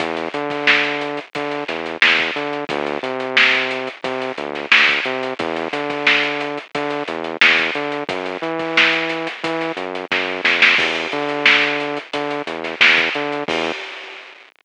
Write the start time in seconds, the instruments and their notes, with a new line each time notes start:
0.00 synth bass 1 E2, kick, closed hi-hat
0.17 closed hi-hat
0.34 synth bass 1 D3, closed hi-hat
0.50 kick, closed hi-hat
0.67 snare
0.84 snare, closed hi-hat
1.01 closed hi-hat
1.17 closed hi-hat
1.35 synth bass 1 D3, kick, closed hi-hat
1.51 closed hi-hat
1.68 synth bass 1 E2, snare, closed hi-hat
1.86 closed hi-hat
2.02 synth bass 1 E2, snare
2.19 kick, closed hi-hat
2.36 synth bass 1 D3, closed hi-hat
2.53 closed hi-hat
2.69 synth bass 1 D2, kick, closed hi-hat
2.86 closed hi-hat
3.03 synth bass 1 C3, closed hi-hat
3.20 closed hi-hat
3.37 snare
3.54 closed hi-hat
3.71 closed hi-hat
3.87 closed hi-hat
4.04 synth bass 1 C3, kick, closed hi-hat
4.22 closed hi-hat
4.38 synth bass 1 D2, closed hi-hat
4.55 snare, closed hi-hat
4.71 synth bass 1 D2, snare
4.89 kick, closed hi-hat
5.05 synth bass 1 C3, closed hi-hat
5.23 closed hi-hat
5.39 synth bass 1 E2, kick, closed hi-hat
5.56 closed hi-hat
5.73 synth bass 1 D3, snare, closed hi-hat
5.90 kick, closed hi-hat
6.07 snare
6.23 closed hi-hat
6.40 closed hi-hat
6.57 closed hi-hat
6.75 synth bass 1 D3, kick, closed hi-hat
6.90 closed hi-hat
7.08 synth bass 1 E2, closed hi-hat
7.24 closed hi-hat
7.41 synth bass 1 E2, snare
7.58 kick, closed hi-hat
7.75 synth bass 1 D3, closed hi-hat
7.92 closed hi-hat
8.09 synth bass 1 F#2, kick, closed hi-hat
8.26 closed hi-hat
8.42 synth bass 1 E3, closed hi-hat
8.59 kick, closed hi-hat
8.77 snare
8.93 closed hi-hat
9.09 snare, closed hi-hat
9.27 snare, closed hi-hat
9.44 synth bass 1 E3, kick, closed hi-hat
9.61 snare, closed hi-hat
9.77 synth bass 1 F#2, closed hi-hat
9.95 closed hi-hat
10.11 synth bass 1 F#2, kick, snare
10.44 synth bass 1 F2, snare
10.62 snare
10.78 synth bass 1 E2, kick, crash
10.95 closed hi-hat
11.12 synth bass 1 D3, closed hi-hat
11.29 closed hi-hat
11.46 snare
11.62 closed hi-hat
11.80 closed hi-hat
11.97 closed hi-hat
12.13 synth bass 1 D3, kick, closed hi-hat
12.30 closed hi-hat
12.46 synth bass 1 E2, closed hi-hat
12.64 snare, closed hi-hat
12.80 synth bass 1 E2, snare
12.97 kick, closed hi-hat
13.14 synth bass 1 D3, closed hi-hat
13.32 closed hi-hat
13.48 synth bass 1 E2, kick, crash